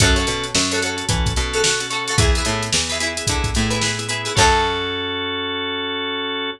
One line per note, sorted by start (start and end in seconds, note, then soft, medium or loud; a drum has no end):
0.00 0.26 F#2 loud
0.00 0.46 C#4 medium
0.00 0.46 F#4 medium
0.00 0.14 F#4 medium
0.00 0.46 A4 medium
0.00 0.14 A4 medium
0.00 0.14 C#5 medium
0.00 kick loud
0.00 closed hi-hat loud
0.16 0.57 F#4 medium
0.16 0.57 A4 medium
0.16 0.57 C#5 medium
0.16 closed hi-hat medium
0.27 0.52 B2 medium
0.27 snare soft
0.27 closed hi-hat medium
0.44 closed hi-hat medium
0.55 1.03 F#2 medium
0.55 snare loud
0.71 0.80 F#4 medium
0.71 0.80 A4 medium
0.71 0.80 C#5 medium
0.71 snare medium
0.71 closed hi-hat medium
0.82 0.96 C#4 medium
0.82 0.96 F#4 medium
0.82 1.29 F#4 medium
0.82 0.96 A4 medium
0.82 1.29 A4 medium
0.82 1.29 C#5 medium
0.82 closed hi-hat loud
0.97 1.05 C#4 medium
0.97 1.05 F#4 medium
0.97 1.05 A4 medium
0.97 closed hi-hat medium
1.09 1.33 E3 medium
1.09 1.33 C#4 medium
1.09 1.33 F#4 medium
1.09 1.33 A4 medium
1.09 kick loud
1.09 closed hi-hat loud
1.26 kick loud
1.26 closed hi-hat medium
1.36 2.10 B2 medium
1.36 1.71 C#4 medium
1.36 1.71 F#4 medium
1.36 1.71 A4 medium
1.36 closed hi-hat medium
1.53 1.62 F#4 medium
1.53 1.62 A4 medium
1.53 1.62 C#5 medium
1.53 closed hi-hat medium
1.64 1.87 F#4 medium
1.64 1.87 A4 medium
1.64 1.87 C#5 medium
1.64 snare loud
1.80 1.89 C#4 medium
1.80 1.89 F#4 medium
1.80 1.89 A4 medium
1.80 closed hi-hat medium
1.90 2.14 C#4 medium
1.90 2.14 F#4 medium
1.90 2.04 F#4 medium
1.90 2.14 A4 medium
1.90 2.04 A4 medium
1.90 2.04 C#5 medium
1.90 closed hi-hat medium
2.08 2.16 F#4 medium
2.08 2.16 A4 medium
2.08 2.16 C#5 medium
2.08 closed hi-hat medium
2.18 2.43 E2 medium
2.18 2.65 B3 medium
2.18 2.65 E4 medium
2.18 2.31 E4 medium
2.18 2.65 G#4 medium
2.18 2.31 G#4 medium
2.18 2.31 B4 medium
2.18 kick loud
2.18 closed hi-hat loud
2.35 2.77 E4 medium
2.35 2.77 G#4 medium
2.35 2.77 B4 medium
2.35 closed hi-hat medium
2.45 2.70 A2 medium
2.45 closed hi-hat loud
2.63 closed hi-hat medium
2.73 3.22 E2 medium
2.73 snare loud
2.89 2.98 E4 medium
2.89 2.98 G#4 medium
2.89 2.98 B4 medium
2.89 snare medium
2.89 closed hi-hat medium
3.00 3.13 B3 medium
3.00 3.13 E4 medium
3.00 3.46 E4 medium
3.00 3.13 G#4 medium
3.00 3.46 G#4 medium
3.00 3.46 B4 medium
3.00 closed hi-hat loud
3.17 3.26 B3 medium
3.17 3.26 E4 medium
3.17 3.26 G#4 medium
3.17 closed hi-hat loud
3.27 3.53 D3 medium
3.27 3.50 B3 medium
3.27 3.50 E4 medium
3.27 3.50 G#4 medium
3.27 kick loud
3.27 closed hi-hat loud
3.44 kick loud
3.44 closed hi-hat medium
3.54 4.29 A2 medium
3.54 3.90 B3 medium
3.54 3.90 E4 medium
3.54 3.90 G#4 medium
3.54 snare medium
3.54 closed hi-hat medium
3.70 3.79 E4 medium
3.70 3.79 G#4 medium
3.70 3.79 B4 medium
3.70 closed hi-hat medium
3.81 4.05 E4 medium
3.81 4.05 G#4 medium
3.81 4.05 B4 medium
3.81 snare loud
3.99 4.07 B3 medium
3.99 4.07 E4 medium
3.99 4.07 G#4 medium
3.99 closed hi-hat medium
4.09 4.33 B3 medium
4.09 4.33 E4 medium
4.09 4.22 E4 medium
4.09 4.22 G#4 medium
4.09 4.33 G#4 medium
4.09 4.22 B4 medium
4.09 closed hi-hat loud
4.25 4.33 E4 medium
4.25 4.33 G#4 medium
4.25 4.33 B4 medium
4.25 closed hi-hat medium
4.35 6.53 F#2 loud
4.35 6.50 C#4 loud
4.35 6.50 F#4 loud
4.35 6.50 A4 loud
4.35 6.52 A4 loud
4.35 6.52 C#5 loud
4.35 kick loud
4.35 crash loud
4.40 6.52 F#4 loud